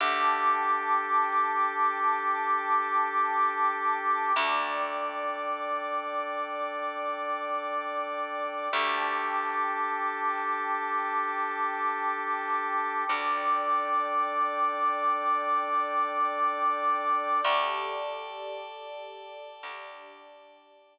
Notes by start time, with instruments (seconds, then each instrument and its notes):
0.00 electric bass (finger) D2, drawbar organ D4 G4 A4, pad 2 (warm) G5 A5 D6
4.36 electric bass (finger) D2, drawbar organ D4 A4 D5, pad 2 (warm) D5 G5 D6
8.72 electric bass (finger) D2, drawbar organ D4 G4 A4, pad 2 (warm) G5 A5 D6
13.09 electric bass (finger) D2, drawbar organ D4 A4 D5, pad 2 (warm) D5 G5 D6
17.45 electric bass (finger) D2, pad 2 (warm) G4 A4 D5, drawbar organ D5 G5 A5
19.63 electric bass (finger) D2, pad 2 (warm) D4 G4 D5